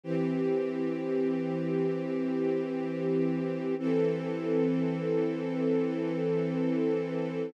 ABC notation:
X:1
M:4/4
L:1/8
Q:1/4=64
K:Em
V:1 name="String Ensemble 1"
[E,CG]8 | [E,CA]8 |]